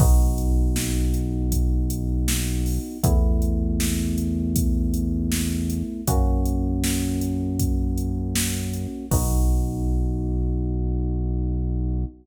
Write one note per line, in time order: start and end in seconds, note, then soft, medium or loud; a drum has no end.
0.00 2.79 B1 loud
0.00 2.98 B3 loud
0.00 2.98 D#4 loud
0.00 2.98 F#4 medium
0.00 kick loud
0.00 crash loud
0.38 closed hi-hat medium
0.76 snare loud
1.14 closed hi-hat medium
1.52 kick medium
1.52 closed hi-hat loud
1.90 closed hi-hat medium
2.28 snare loud
2.66 open hi-hat medium
3.03 5.83 E2 loud
3.03 6.01 A3 loud
3.03 6.01 B3 loud
3.03 6.01 E4 loud
3.03 kick loud
3.03 closed hi-hat loud
3.42 closed hi-hat medium
3.80 snare loud
4.18 closed hi-hat medium
4.56 kick medium
4.56 closed hi-hat loud
4.94 closed hi-hat medium
5.32 snare loud
5.70 closed hi-hat medium
6.07 8.87 F#2 medium
6.07 9.06 A#3 loud
6.07 9.06 C#4 loud
6.07 9.06 F#4 loud
6.07 kick loud
6.07 closed hi-hat loud
6.45 closed hi-hat medium
6.84 snare loud
7.21 closed hi-hat medium
7.59 kick medium
7.59 closed hi-hat loud
7.98 closed hi-hat medium
8.35 snare loud
8.73 closed hi-hat medium
9.11 12.05 B1 loud
9.11 12.04 B3 loud
9.11 12.04 D#4 medium
9.11 12.04 F#4 loud
9.11 kick loud
9.11 crash loud